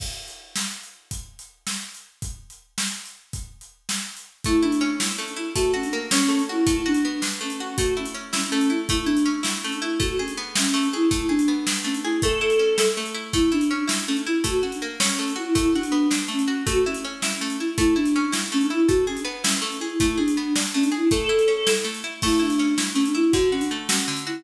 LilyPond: <<
  \new Staff \with { instrumentName = "Choir Aahs" } { \time 6/8 \key a \major \tempo 4. = 108 r2. | r2. | r2. | r2. |
e'8 d'4 r8 cis'16 d'16 e'8 | fis'8 cis'16 d'16 r8 cis'4 e'8 | e'8 d'4 r8 cis'16 cis'16 cis'8 | fis'8 cis'16 cis'16 r8 cis'4 e'8 |
e'8 d'4 r8 cis'16 d'16 e'8 | fis'8 cis'16 d'16 r8 cis'4 e'8 | e'8 d'4 r8 cis'16 d'16 e'8 | a'2 r4 |
e'8 d'4 r8 cis'16 d'16 e'8 | fis'8 cis'16 d'16 r8 cis'4 e'8 | e'8 d'4 r8 cis'16 cis'16 cis'8 | fis'8 cis'16 cis'16 r8 cis'4 e'8 |
e'8 d'4 r8 cis'16 d'16 e'8 | fis'8 cis'16 d'16 r8 cis'4 e'8 | e'8 d'4 r8 cis'16 d'16 e'8 | a'2 r4 |
e'8 d'4 r8 cis'16 d'16 e'8 | fis'8 cis'16 d'16 r8 cis'4 e'8 | }
  \new Staff \with { instrumentName = "Pizzicato Strings" } { \time 6/8 \key a \major r2. | r2. | r2. | r2. |
a8 e'8 cis'8 e'8 a8 e'8 | a8 fis'8 ais8 cis'8 a8 fis'8 | a8 fis'8 b8 d'8 a8 fis'8 | a8 e'8 cis'8 e'8 a8 e'8 |
a8 e'8 cis'8 e'8 a8 e'8 | a8 gis'8 b8 e'8 a8 gis'8 | a8 gis'8 b8 d'8 a8 gis'8 | a8 e'8 cis'8 e'8 a8 e'8 |
a8 e'8 cis'8 e'8 a8 e'8 | a8 fis'8 ais8 cis'8 a8 fis'8 | a8 fis'8 b8 d'8 a8 fis'8 | a8 e'8 cis'8 e'8 a8 e'8 |
a8 e'8 cis'8 e'8 a8 e'8 | a8 gis'8 b8 e'8 a8 gis'8 | a8 gis'8 b8 d'8 a8 gis'8 | a8 e'8 cis'8 e'8 a8 e'8 |
a8 e'8 cis'8 e'8 a8 e'8 | d8 fis'8 a8 fis'8 d8 fis'8 | }
  \new DrumStaff \with { instrumentName = "Drums" } \drummode { \time 6/8 <cymc bd>8. hh8. sn8. hh8. | <hh bd>8. hh8. sn8. hh8. | <hh bd>8. hh8. sn8. hh8. | <hh bd>8. hh8. sn8. hh8. |
<hh bd>8. hh8. sn8. hh8. | <hh bd>8. hh8. sn8. hh8. | <hh bd>8. hh8. sn8. hh8. | <hh bd>8. hh8. sn8. hh8. |
<hh bd>8. hh8. sn8. hh8. | <hh bd>8. hh8. sn8. hh8. | <hh bd>8. hh8. sn8. hh8. | <hh bd>8. hh8. sn8. hh8. |
<hh bd>8. hh8. sn8. hh8. | <hh bd>8. hh8. sn8. hh8. | <hh bd>8. hh8. sn8. hh8. | <hh bd>8. hh8. sn8. hh8. |
<hh bd>8. hh8. sn8. hh8. | <hh bd>8. hh8. sn8. hh8. | <hh bd>8. hh8. sn8. hh8. | <hh bd>8. hh8. sn8. hh8. |
<cymc bd>8. hh8. sn8. hh8. | <hh bd>8. hh8. sn8. hh8. | }
>>